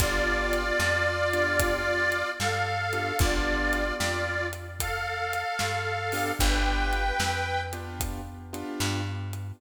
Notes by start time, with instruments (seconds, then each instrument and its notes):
0.00 electric bass (finger) G1, acoustic grand piano B3 D4 F4 G4, harmonica F4 D5, kick, closed hi-hat
0.53 closed hi-hat
0.80 electric bass (finger) F2, snare
1.33 acoustic grand piano B3 D4 F4 G4, closed hi-hat
1.60 kick, closed hi-hat
2.12 closed hi-hat
2.39 electric bass (finger) G2, harmonica A4 F5, snare
2.93 acoustic grand piano B3 D4 F4 G4, closed hi-hat
3.19 electric bass (finger) G1, acoustic grand piano B3 D4 F4 G4, harmonica F4 D5, kick, closed hi-hat
3.73 closed hi-hat
3.99 electric bass (finger) F2, harmonica F4 D5, snare
4.53 closed hi-hat
4.80 harmonica A4 F5, kick, closed hi-hat
5.33 closed hi-hat
5.59 electric bass (finger) G2, snare
6.12 acoustic grand piano B3 D4 F4 G4, open hi-hat
6.39 electric bass (finger) G1, acoustic grand piano B3 D4 F4 G4, harmonica B4 G5, kick, closed hi-hat
6.93 closed hi-hat
7.20 electric bass (finger) F2, snare
7.73 acoustic grand piano B3 D4 F4 G4, closed hi-hat
8.00 kick, closed hi-hat
8.53 acoustic grand piano B3 D4 F4 G4, closed hi-hat
8.80 electric bass (finger) G2, snare
9.33 closed hi-hat